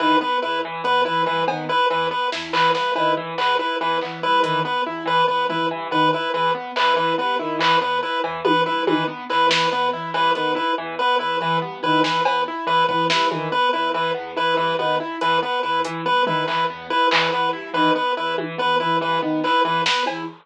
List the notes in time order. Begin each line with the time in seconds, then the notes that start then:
0.00 D#3 E3 B4
0.21 B3 B4
0.42 E2 E4 B4
0.65 E3
0.84 E2 B3 B4, closed hi-hat
1.05 E3 E4 B4
1.26 G2 E3 B4
1.47 D#3 B3, cowbell
1.69 E4 B4
1.90 E2 E3 B4
2.11 B3 B4
2.32 E2 E4, snare
2.53 E3 B4, clap
2.74 G2 B3 B4, snare
2.95 D#3 E4 B4, cowbell
3.17 E3
3.38 E2 B3 B4, clap
3.59 E4 B4
3.79 E2 E3 B4
4.01 E3 B3, clap
4.21 G2 E4 B4
4.42 D#3 E3 B4, closed hi-hat
4.65 B3 B4
4.85 E2 E4
5.06 E3 B4
5.27 E2 B3 B4, kick
5.49 E3 E4 B4, floor tom
5.70 G2 E3
5.91 D#3 B3 B4
6.13 E4 B4
6.34 E2 E3 B4
6.55 B3
6.76 E2 E4 B4, clap
6.96 E3 B4
7.18 G2 B3 B4
7.39 D#3 E4
7.59 E3 B4, clap
7.81 E2 B3 B4
8.03 E4 B4
8.24 E2 E3, cowbell
8.44 E3 B3 B4, high tom
8.66 G2 E4 B4
8.87 D#3 E3 B4, high tom
9.08 B3
9.30 E2 E4 B4, clap
9.49 E3 B4, snare
9.71 E2 B3 B4
9.93 E3 E4
10.13 G2 E3 B4, cowbell
10.35 D#3 B3 B4, closed hi-hat
10.55 E4 B4, kick
10.77 E2 E3
10.99 B3 B4
11.19 E2 E4 B4
11.40 E3 B4
11.61 G2 B3
11.83 D#3 E4 B4
12.04 E3 B4, snare
12.25 E2 B3 B4, cowbell
12.48 E4
12.67 E2 E3 B4
12.88 E3 B3 B4, kick
13.10 G2 E4 B4, snare
13.31 D#3 E3, high tom
13.52 B3 B4
13.73 E2 E4 B4
13.94 E3 B4
14.14 E2 B3
14.36 E3 E4 B4
14.57 G2 E3 B4
14.78 D#3 B3 B4, high tom
15.00 E4
15.21 E2 E3 B4, closed hi-hat
15.42 B3 B4
15.63 E2 E4 B4
15.85 E3, closed hi-hat
16.05 G2 B3 B4
16.25 D#3 E4 B4, floor tom
16.47 E3 B4, clap
16.70 E2 B3
16.90 E4 B4
17.11 E2 E3 B4, clap
17.32 E3 B3 B4
17.53 G2 E4
17.74 D#3 E3 B4
17.95 B3 B4
18.16 E2 E4 B4
18.38 E3, high tom
18.58 E2 B3 B4
18.80 E3 E4 B4
19.01 G2 E3 B4
19.21 D#3 B3
19.44 E4 B4, clap
19.65 E2 E3 B4
19.86 B3 B4, snare
20.06 E2 E4, cowbell